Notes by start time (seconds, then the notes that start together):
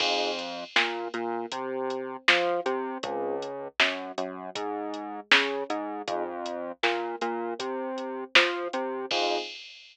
0.00 F2 C4 D#4 F4 G#4, kick, crash
0.39 closed hi-hat
0.76 A#2 A#3, snare
1.14 A#2 A#3, closed hi-hat
1.52 C3 C4, kick, closed hi-hat
1.90 closed hi-hat
2.28 F3 F4, snare
2.66 C3 C4, closed hi-hat
3.03 C#2 C4 C#4 F4 G#4, kick, closed hi-hat
3.42 closed hi-hat
3.80 F#2 F#3, snare
4.18 F#2 F#3, closed hi-hat
4.55 G#2 G#3, kick, closed hi-hat
4.94 closed hi-hat
5.31 C#3 C#4, snare
5.70 G#2 G#3, closed hi-hat
6.08 F2 C4 D#4 F4 G#4, kick, closed hi-hat
6.46 closed hi-hat
6.83 A#2 A#3, snare
7.21 A#2 A#3, closed hi-hat
7.59 C3 C4, kick, closed hi-hat
7.98 closed hi-hat
8.35 F3 F4, snare
8.73 C3 C4, closed hi-hat
9.11 F2 C4 D#4 F4 G#4, kick, crash